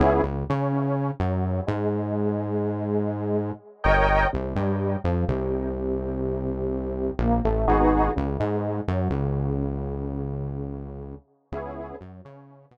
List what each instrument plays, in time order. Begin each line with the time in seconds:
0.00 synth bass 1 C#2, lead 2 (sawtooth) B3 C#4 E4 G#4
0.23 synth bass 1 C#2, lead 2 (sawtooth) C#3
0.49 synth bass 1 C#3, lead 2 (sawtooth) C#4
1.20 synth bass 1 F#2, lead 2 (sawtooth) F#3
1.67 synth bass 1 G#2, lead 2 (sawtooth) G#3
3.84 synth bass 1 G1, lead 2 (sawtooth) A#4 C#5 D#5 G5
4.33 synth bass 1 C2, lead 2 (sawtooth) C3
4.55 synth bass 1 G2, lead 2 (sawtooth) G3
5.04 synth bass 1 F2, lead 2 (sawtooth) F3
5.28 synth bass 1 C2, lead 2 (sawtooth) C3
7.19 synth bass 1 A#1, lead 2 (sawtooth) A#3
7.45 synth bass 1 A1, lead 2 (sawtooth) A3
7.67 synth bass 1 G#1, lead 2 (sawtooth) B3 D#4 F#4 G#4
8.16 synth bass 1 C#2, lead 2 (sawtooth) C#3
8.40 synth bass 1 G#2, lead 2 (sawtooth) G#3
8.88 synth bass 1 F#2, lead 2 (sawtooth) F#3
9.10 synth bass 1 C#2, lead 2 (sawtooth) C#3
11.52 synth bass 1 C#2, lead 2 (sawtooth) B3 C#4 E4 G#4
12.01 synth bass 1 F#2, lead 2 (sawtooth) F#3
12.25 synth bass 1 C#3, lead 2 (sawtooth) C#4
12.71 synth bass 1 B2, lead 2 (sawtooth) B3